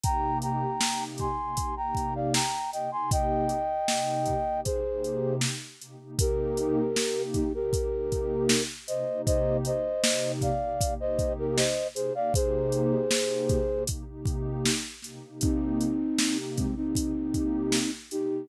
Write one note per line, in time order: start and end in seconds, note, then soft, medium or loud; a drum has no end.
0.04 0.65 C3 loud
0.04 0.65 A#3 loud
0.04 0.65 D#4 medium
0.04 0.65 G4 loud
0.04 0.38 G5 loud
0.04 0.38 A#5 loud
0.04 kick medium
0.04 closed hi-hat medium
0.42 1.04 G5 medium
0.42 1.04 A#5 medium
0.42 closed hi-hat medium
0.81 1.27 C3 medium
0.81 1.27 A#3 medium
0.81 1.27 D#4 medium
0.81 1.27 G4 medium
0.81 snare medium
1.18 1.75 G#5 medium
1.18 1.75 C6 medium
1.18 kick medium
1.18 closed hi-hat medium
1.38 1.54 C3 medium
1.38 1.54 A#3 medium
1.38 1.54 D#4 loud
1.38 1.54 G4 medium
1.57 1.73 C3 medium
1.57 1.73 A#3 medium
1.57 1.73 D#4 loud
1.57 1.73 G4 medium
1.57 kick medium
1.57 closed hi-hat medium
1.77 2.38 C3 medium
1.77 2.38 A#3 medium
1.77 2.38 D#4 medium
1.77 2.38 G4 medium
1.77 2.14 G5 medium
1.77 2.14 A#5 medium
1.95 kick medium
1.95 closed hi-hat medium
2.15 2.33 D5 medium
2.15 2.33 F5 medium
2.34 2.71 G5 medium
2.34 2.71 A#5 medium
2.34 snare medium
2.72 2.88 C3 medium
2.72 2.88 A#3 medium
2.72 2.88 D#4 medium
2.72 2.88 G4 medium
2.72 2.91 D#5 medium
2.72 2.91 G5 medium
2.72 closed hi-hat medium
2.92 3.53 C3 medium
2.92 3.53 A#3 medium
2.92 3.53 D#4 medium
2.92 3.53 G4 medium
2.92 3.10 G#5 medium
2.92 3.10 C6 medium
3.11 4.61 D#5 loud
3.11 4.61 G5 loud
3.11 kick medium
3.11 closed hi-hat medium
3.49 closed hi-hat medium
3.88 4.34 C3 medium
3.88 4.34 A#3 medium
3.88 4.34 D#4 medium
3.88 4.34 G4 medium
3.88 snare medium
4.26 kick medium
4.26 closed hi-hat medium
4.46 4.62 C3 medium
4.46 4.62 A#3 medium
4.46 4.62 D#4 medium
4.46 4.62 G4 medium
4.65 4.80 C3 medium
4.65 4.80 A#3 medium
4.65 4.80 D#4 medium
4.65 4.80 G4 medium
4.65 5.35 G#4 medium
4.65 5.35 C5 loud
4.65 kick medium
4.65 closed hi-hat medium
4.84 5.46 C3 loud
4.84 5.46 A#3 medium
4.84 5.46 D#4 medium
4.84 5.46 G4 medium
5.04 closed hi-hat medium
5.41 snare medium
5.80 5.96 C3 medium
5.80 5.96 A#3 medium
5.80 5.96 D#4 medium
5.80 5.96 G4 medium
5.80 closed hi-hat medium
6.00 6.15 C3 medium
6.00 6.15 A#3 medium
6.00 6.15 D#4 medium
6.00 6.15 G4 medium
6.19 6.81 C3 loud
6.19 6.81 A#3 loud
6.19 6.81 D#4 loud
6.19 6.81 G4 loud
6.19 7.22 G4 loud
6.19 7.22 A#4 loud
6.19 kick medium
6.19 closed hi-hat loud
6.57 closed hi-hat medium
6.96 7.42 C3 medium
6.96 7.42 A#3 loud
6.96 7.42 D#4 medium
6.96 7.42 G4 loud
6.96 snare medium
7.34 7.53 D#4 medium
7.34 7.53 G4 loud
7.34 kick medium
7.34 closed hi-hat medium
7.54 7.69 C3 medium
7.54 7.69 A#3 loud
7.54 7.69 D#4 loud
7.54 7.69 G4 loud
7.54 8.63 G4 medium
7.54 8.63 A#4 loud
7.73 7.88 C3 loud
7.73 7.88 A#3 medium
7.73 7.88 D#4 loud
7.73 7.88 G4 medium
7.73 kick medium
7.73 closed hi-hat medium
7.92 8.53 C3 medium
7.92 8.53 A#3 medium
7.92 8.53 D#4 loud
7.92 8.53 G4 loud
8.12 kick medium
8.12 closed hi-hat medium
8.49 snare loud
8.88 9.04 C3 loud
8.88 9.04 A#3 medium
8.88 9.04 D#4 loud
8.88 9.04 G4 medium
8.88 9.22 C5 medium
8.88 9.22 D#5 loud
8.88 closed hi-hat medium
9.08 9.69 C3 medium
9.08 9.69 A#3 loud
9.08 9.69 D#4 loud
9.08 9.69 G4 medium
9.26 9.57 C5 loud
9.26 9.57 D#5 loud
9.26 kick medium
9.26 closed hi-hat medium
9.65 10.32 C5 medium
9.65 10.32 D#5 loud
9.65 closed hi-hat medium
10.04 10.50 C3 loud
10.04 10.50 A#3 medium
10.04 10.50 D#4 medium
10.04 10.50 G4 medium
10.04 snare loud
10.41 10.94 D5 medium
10.41 10.94 F5 loud
10.41 kick medium
10.41 closed hi-hat medium
10.62 10.77 C3 medium
10.62 10.77 A#3 loud
10.62 10.77 D#4 loud
10.62 10.77 G4 loud
10.81 10.96 C3 medium
10.81 10.96 A#3 loud
10.81 10.96 D#4 medium
10.81 10.96 G4 loud
10.81 kick medium
10.81 closed hi-hat medium
10.99 11.61 C3 medium
10.99 11.61 A#3 medium
10.99 11.61 D#4 medium
10.99 11.61 G4 loud
10.99 11.33 C5 medium
10.99 11.33 D#5 loud
11.19 kick medium
11.19 closed hi-hat medium
11.39 11.57 G4 medium
11.39 11.57 A#4 loud
11.57 11.88 C5 medium
11.57 11.88 D#5 loud
11.57 snare medium
11.95 12.11 C3 loud
11.95 12.11 A#3 loud
11.95 12.11 D#4 loud
11.95 12.11 G4 loud
11.95 12.13 G#4 medium
11.95 12.13 C5 loud
11.95 closed hi-hat medium
12.15 12.30 C3 loud
12.15 12.30 A#3 loud
12.15 12.30 D#4 medium
12.15 12.30 G4 loud
12.15 12.33 D5 loud
12.15 12.33 F5 loud
12.34 12.95 C3 loud
12.34 12.95 A#3 loud
12.34 12.95 D#4 loud
12.34 12.95 G4 loud
12.34 13.84 G#4 loud
12.34 13.84 C5 loud
12.34 kick medium
12.34 closed hi-hat medium
12.72 closed hi-hat medium
13.11 13.58 C3 medium
13.11 13.58 A#3 loud
13.11 13.58 D#4 medium
13.11 13.58 G4 medium
13.11 snare medium
13.49 kick medium
13.49 closed hi-hat medium
13.69 13.84 C3 loud
13.69 13.84 A#3 loud
13.69 13.84 D#4 medium
13.69 13.84 G4 medium
13.87 14.04 C3 loud
13.87 14.04 A#3 medium
13.87 14.04 D#4 medium
13.87 14.04 G4 loud
13.87 kick medium
13.87 closed hi-hat medium
14.08 14.69 C3 loud
14.08 14.69 A#3 medium
14.08 14.69 D#4 loud
14.08 14.69 G4 loud
14.25 kick medium
14.25 closed hi-hat medium
14.66 snare medium
15.02 15.18 C3 loud
15.02 15.18 A#3 medium
15.02 15.18 D#4 loud
15.02 15.18 G4 loud
15.02 snare soft
15.02 closed hi-hat medium
15.23 15.84 C3 medium
15.23 15.84 A#3 loud
15.23 15.84 D#4 loud
15.23 15.84 G4 medium
15.41 16.37 C4 loud
15.41 16.37 D#4 loud
15.41 kick medium
15.41 closed hi-hat medium
15.81 closed hi-hat medium
16.19 16.65 C3 medium
16.19 16.65 A#3 medium
16.19 16.65 D#4 medium
16.19 16.65 G4 loud
16.19 snare medium
16.56 16.75 G#3 medium
16.56 16.75 C4 loud
16.56 kick medium
16.56 closed hi-hat medium
16.76 16.92 C3 medium
16.76 16.92 A#3 medium
16.76 17.91 C4 loud
16.76 17.91 D#4 loud
16.76 16.92 D#4 loud
16.76 16.92 G4 loud
16.95 17.12 C3 medium
16.95 17.12 A#3 medium
16.95 17.12 D#4 loud
16.95 17.12 G4 loud
16.95 kick medium
16.95 closed hi-hat medium
17.16 17.77 C3 medium
17.16 17.77 A#3 loud
17.16 17.77 D#4 medium
17.16 17.77 G4 loud
17.34 kick medium
17.34 closed hi-hat medium
17.72 snare medium
18.11 18.27 C3 loud
18.11 18.27 A#3 loud
18.11 18.27 D#4 medium
18.11 18.47 D#4 loud
18.11 18.27 G4 loud
18.11 18.47 G4 loud
18.11 closed hi-hat medium
18.31 18.46 C3 medium
18.31 18.46 A#3 loud
18.31 18.46 D#4 medium
18.31 18.46 G4 loud